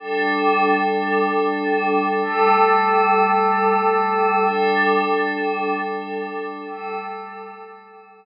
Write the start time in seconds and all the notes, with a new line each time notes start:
0.00 G3 D4 A4
2.22 G3 A3 A4
4.45 G3 D4 A4
6.67 G3 A3 A4